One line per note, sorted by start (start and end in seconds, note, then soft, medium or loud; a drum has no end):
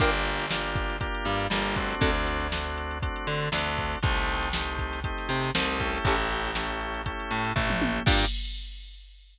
0.00 1.07 G1 loud
0.00 0.46 A#3 loud
0.00 0.46 D4 loud
0.00 0.10 D4 loud
0.00 0.46 F4 loud
0.00 0.10 F4 loud
0.00 0.46 G4 loud
0.00 0.10 G4 loud
0.00 0.10 A#4 loud
0.00 kick medium
0.00 closed hi-hat medium
0.14 closed hi-hat medium
0.25 closed hi-hat medium
0.39 snare soft
0.39 closed hi-hat medium
0.51 0.97 A#3 medium
0.51 0.97 D4 loud
0.51 0.97 F4 loud
0.51 0.97 G4 medium
0.51 snare loud
0.64 closed hi-hat medium
0.76 kick medium
0.76 closed hi-hat medium
0.89 snare soft
0.89 closed hi-hat medium
1.01 1.47 A#3 loud
1.01 1.47 D4 medium
1.01 1.47 F4 medium
1.01 1.47 G4 medium
1.01 kick medium
1.01 closed hi-hat medium
1.15 closed hi-hat medium
1.25 1.47 G2 medium
1.25 1.48 G3 medium
1.25 snare soft
1.25 closed hi-hat medium
1.40 closed hi-hat medium
1.50 1.95 G1 medium
1.50 1.94 G3 medium
1.50 1.76 A#3 loud
1.50 1.76 D4 medium
1.50 1.76 F4 medium
1.50 1.76 G4 medium
1.50 snare medium
1.65 closed hi-hat medium
1.76 2.47 A3 loud
1.76 2.47 C4 loud
1.76 2.47 D4 loud
1.76 2.47 F#4 loud
1.76 kick medium
1.76 closed hi-hat medium
1.90 snare soft
1.90 closed hi-hat medium
2.01 3.09 D2 loud
2.01 2.11 C4 loud
2.01 2.11 D4 loud
2.01 2.11 F#4 loud
2.01 2.11 A4 loud
2.01 kick medium
2.01 closed hi-hat medium
2.15 closed hi-hat medium
2.27 closed hi-hat medium
2.41 snare soft
2.41 closed hi-hat medium
2.52 2.98 A3 loud
2.52 2.98 C4 medium
2.52 2.98 D4 medium
2.52 2.98 F#4 medium
2.52 snare medium
2.66 snare soft
2.66 closed hi-hat medium
2.78 closed hi-hat medium
2.91 closed hi-hat medium
3.02 3.48 A3 medium
3.02 3.48 C4 medium
3.02 3.48 D4 medium
3.02 3.48 F#4 medium
3.02 kick medium
3.02 closed hi-hat loud
3.16 closed hi-hat medium
3.27 3.49 D3 medium
3.27 3.50 D4 medium
3.27 closed hi-hat medium
3.42 closed hi-hat medium
3.52 3.96 D2 medium
3.52 3.98 A3 medium
3.52 3.98 C4 medium
3.52 3.98 D4 medium
3.52 3.97 D4 medium
3.52 3.98 F#4 medium
3.52 snare medium
3.67 snare soft
3.67 closed hi-hat medium
3.78 kick medium
3.78 closed hi-hat medium
3.92 open hi-hat medium
4.03 5.10 C2 loud
4.03 4.49 A3 loud
4.03 4.49 C4 loud
4.03 4.49 D#4 medium
4.03 4.49 G4 loud
4.03 kick loud
4.03 closed hi-hat medium
4.17 snare soft
4.17 closed hi-hat medium
4.29 closed hi-hat medium
4.43 closed hi-hat medium
4.53 5.00 A3 medium
4.53 5.00 C4 medium
4.53 5.00 D#4 medium
4.53 5.00 G4 medium
4.53 snare loud
4.67 closed hi-hat medium
4.79 kick medium
4.79 closed hi-hat medium
4.93 snare soft
4.93 closed hi-hat medium
5.04 5.50 A3 medium
5.04 5.50 C4 medium
5.04 5.50 D#4 medium
5.04 5.50 G4 medium
5.04 kick medium
5.04 closed hi-hat medium
5.18 snare soft
5.18 closed hi-hat medium
5.29 5.51 C3 loud
5.29 5.52 C4 medium
5.29 snare soft
5.29 closed hi-hat medium
5.44 snare soft
5.44 closed hi-hat medium
5.55 5.98 C2 medium
5.55 5.79 A3 medium
5.55 5.79 C4 loud
5.55 5.99 C4 medium
5.55 5.79 D#4 medium
5.55 5.79 G4 loud
5.55 snare loud
5.69 closed hi-hat medium
5.80 6.51 A3 loud
5.80 6.51 C#4 medium
5.80 6.51 E4 loud
5.80 6.51 G4 loud
5.80 kick medium
5.80 closed hi-hat medium
5.93 snare soft
5.93 open hi-hat medium
6.05 7.13 A1 loud
6.05 6.16 C#4 loud
6.05 6.16 E4 loud
6.05 6.16 G4 loud
6.05 6.16 A4 loud
6.05 kick medium
6.05 closed hi-hat medium
6.19 closed hi-hat medium
6.30 closed hi-hat medium
6.44 snare soft
6.44 closed hi-hat medium
6.55 7.02 A3 loud
6.55 7.02 C#4 medium
6.55 7.02 E4 medium
6.55 7.02 G4 medium
6.55 snare medium
6.81 closed hi-hat medium
6.94 closed hi-hat medium
7.06 7.52 A3 medium
7.06 7.52 C#4 medium
7.06 7.52 E4 medium
7.06 7.52 G4 medium
7.06 kick medium
7.06 closed hi-hat medium
7.20 closed hi-hat medium
7.31 7.53 A2 medium
7.31 7.53 A3 medium
7.31 closed hi-hat medium
7.45 closed hi-hat medium
7.56 7.99 A1 medium
7.56 7.99 A3 medium
7.56 8.02 A3 medium
7.56 8.02 C#4 medium
7.56 8.02 E4 medium
7.56 8.02 G4 medium
7.56 kick medium
7.56 floor tom medium
7.70 mid tom medium
7.82 high tom medium
8.06 8.25 G2 loud
8.06 8.25 A#3 loud
8.06 8.25 D4 loud
8.06 8.25 F4 loud
8.06 8.25 G4 loud
8.06 8.25 A#4 loud
8.06 kick loud
8.06 crash loud